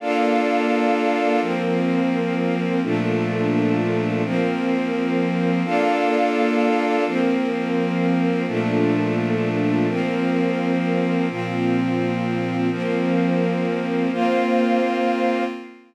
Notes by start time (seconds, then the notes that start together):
0.00 A#3 D4 F4 A4 D5 F5
1.41 F3 A#3 C4 A#4
2.82 A#2 F3 A3 A#3 D4 F4 A4
4.23 F3 A#3 C4 A#4
5.65 A#3 D4 F4 A4 D5 F5
7.06 F3 A#3 C4 A#4
8.47 A#2 F3 A3 A#3 D4 F4 A4
9.88 F3 A#3 C4 A#4
11.29 A#2 F3 A#3 C4 F4
12.71 F3 A#3 C4 A#4
14.12 A#3 C4 F4 C5 F5